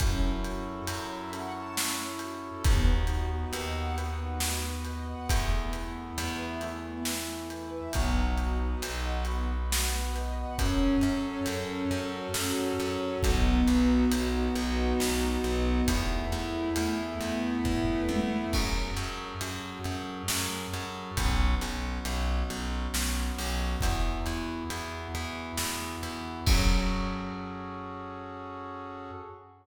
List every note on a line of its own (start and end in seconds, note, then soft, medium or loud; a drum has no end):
0.00 0.81 F#2 loud
0.00 0.20 C#4 loud
0.00 1.32 C#4 medium
0.00 1.32 E4 medium
0.00 1.32 F#4 medium
0.00 1.32 A4 medium
0.00 kick medium
0.00 closed hi-hat medium
0.22 0.41 E4 medium
0.44 0.64 F#4 medium
0.44 closed hi-hat medium
0.66 0.85 A4 medium
0.87 2.51 F#2 medium
0.87 1.08 C#5 medium
0.87 closed hi-hat medium
1.10 1.30 E5 medium
1.33 2.63 C#4 medium
1.33 2.63 E4 medium
1.33 2.63 A4 medium
1.33 2.63 C#5 medium
1.33 1.53 F#5 medium
1.33 closed hi-hat medium
1.55 1.75 A5 medium
1.76 1.96 C#4 medium
1.76 snare loud
1.99 2.19 E4 medium
2.19 2.40 F#4 medium
2.19 closed hi-hat medium
2.42 2.62 A4 medium
2.64 3.46 D#2 loud
2.64 2.84 B3 loud
2.64 3.96 B3 medium
2.64 3.96 D#4 medium
2.64 3.96 F#4 medium
2.64 kick loud
2.64 closed hi-hat medium
2.87 3.07 D#4 medium
3.07 3.28 F#4 medium
3.07 closed hi-hat medium
3.31 3.51 B4 medium
3.53 5.15 D#2 medium
3.53 3.73 D#5 medium
3.53 closed hi-hat medium
3.75 3.95 F#5 medium
3.97 4.17 B3 medium
3.97 5.28 B3 loud
3.97 5.28 F#4 loud
3.97 5.28 B4 medium
3.97 closed hi-hat medium
4.19 4.39 D#4 medium
4.40 4.61 F#4 medium
4.40 snare medium
4.63 4.83 B4 medium
4.85 5.06 D#5 medium
4.85 closed hi-hat medium
5.07 5.27 F#5 medium
5.29 6.11 E2 loud
5.29 5.49 A3 loud
5.29 6.60 A3 medium
5.29 6.60 B3 medium
5.29 6.60 E4 medium
5.29 kick medium
5.29 closed hi-hat loud
5.51 5.71 B3 medium
5.73 5.93 E4 medium
5.73 closed hi-hat medium
5.96 6.16 A4 medium
6.18 7.80 E2 loud
6.18 6.38 B4 loud
6.18 closed hi-hat medium
6.39 6.59 E5 medium
6.61 7.93 E3 medium
6.61 6.82 A3 medium
6.61 7.93 A3 medium
6.61 7.93 E4 medium
6.61 closed hi-hat medium
6.84 7.04 B3 medium
7.05 7.26 E4 medium
7.05 snare medium
7.28 7.48 A4 medium
7.50 7.70 B4 medium
7.50 closed hi-hat medium
7.72 7.92 E5 medium
7.93 8.75 B1 medium
7.93 8.14 B3 loud
7.93 9.25 B3 medium
7.93 9.25 D#4 medium
7.93 9.25 F#4 loud
7.93 kick medium
7.93 closed hi-hat medium
8.17 8.36 D#4 medium
8.38 8.58 F#4 medium
8.38 closed hi-hat medium
8.60 8.80 B4 medium
8.82 10.45 B1 medium
8.82 9.03 D#5 medium
8.82 closed hi-hat medium
9.04 9.24 F#5 medium
9.25 9.46 B3 medium
9.25 10.58 B3 medium
9.25 10.58 F#4 medium
9.25 10.58 B4 medium
9.25 closed hi-hat medium
9.48 9.68 D#4 medium
9.70 9.90 F#4 medium
9.70 snare loud
9.92 10.12 B4 medium
10.15 10.35 D#5 medium
10.15 closed hi-hat medium
10.37 10.56 F#5 medium
10.58 10.97 F#2 loud
10.58 11.47 C#4 loud
10.58 13.21 C#4 medium
10.58 13.21 F#4 medium
10.58 13.21 A4 medium
10.58 kick medium
10.58 closed hi-hat medium
11.01 11.40 F#2 medium
11.01 12.79 A4 medium
11.01 closed hi-hat medium
11.46 11.85 F#2 loud
11.46 12.35 C#4 medium
11.46 closed hi-hat medium
11.91 12.28 F#2 medium
11.91 13.18 F#4 medium
11.91 closed hi-hat medium
12.34 12.73 F#2 medium
12.34 13.19 C#4 loud
12.34 snare medium
12.79 13.17 F#2 medium
12.79 13.21 A4 medium
12.79 closed hi-hat medium
13.23 13.61 B1 loud
13.23 14.11 B3 loud
13.23 15.85 B3 medium
13.23 15.85 D#4 medium
13.23 15.85 F#4 medium
13.23 kick medium
13.23 closed hi-hat medium
13.67 14.05 B1 medium
13.67 15.44 F#4 medium
13.67 closed hi-hat medium
14.12 14.49 B1 medium
14.12 14.99 B3 medium
14.12 closed hi-hat medium
14.56 14.93 B1 medium
14.56 15.82 D#4 loud
14.56 closed hi-hat medium
15.00 15.38 B1 medium
15.00 15.84 B3 medium
15.00 snare medium
15.44 15.82 B1 medium
15.44 15.86 F#4 medium
15.44 closed hi-hat medium
15.88 16.26 E2 loud
15.88 18.50 A3 medium
15.88 16.76 A3 medium
15.88 18.50 B3 medium
15.88 18.50 E4 medium
15.88 kick medium
15.88 closed hi-hat loud
16.32 16.70 E2 medium
16.32 18.09 E4 medium
16.32 closed hi-hat medium
16.76 17.14 E2 medium
16.76 17.64 A3 medium
16.76 closed hi-hat medium
17.20 17.58 E2 medium
17.20 18.46 B3 medium
17.20 closed hi-hat medium
17.65 18.02 E2 medium
17.65 18.48 A3 loud
17.65 kick medium
17.65 floor tom medium
18.09 18.46 E2 medium
18.09 18.51 E4 medium
18.09 high tom medium
18.53 18.90 F#2 medium
18.53 21.15 C#4 medium
18.53 21.15 F#4 medium
18.53 21.15 G#4 medium
18.53 21.15 A4 medium
18.53 kick medium
18.53 crash medium
18.97 19.34 F#2 medium
18.97 closed hi-hat medium
19.41 19.79 F#2 medium
19.41 closed hi-hat medium
19.84 20.23 F#2 medium
19.84 closed hi-hat medium
20.28 20.67 F#2 medium
20.28 snare loud
20.74 21.11 F#2 medium
20.74 closed hi-hat medium
21.17 21.55 B1 loud
21.17 23.80 B3 medium
21.17 23.80 C#4 medium
21.17 23.80 F#4 medium
21.17 kick medium
21.17 closed hi-hat medium
21.61 21.99 B1 medium
21.61 closed hi-hat medium
22.05 22.43 B1 medium
22.05 closed hi-hat medium
22.50 22.88 B1 medium
22.50 closed hi-hat medium
22.94 23.31 B1 medium
22.94 snare medium
23.38 23.76 B1 medium
23.38 open hi-hat medium
23.81 24.20 E2 loud
23.81 26.44 B3 medium
23.81 26.44 E4 medium
23.81 26.44 F#4 medium
23.81 kick medium
23.81 closed hi-hat medium
24.26 24.64 E2 medium
24.26 closed hi-hat medium
24.70 25.08 E2 medium
24.70 closed hi-hat medium
25.15 25.52 E2 medium
25.15 closed hi-hat medium
25.58 25.96 E2 medium
25.58 snare medium
26.03 26.40 E2 medium
26.03 closed hi-hat medium
26.47 29.10 F#2 loud
26.47 29.11 C#4 loud
26.47 29.11 F#4 loud
26.47 29.11 G#4 loud
26.47 29.11 A4 loud
26.47 kick loud
26.47 crash loud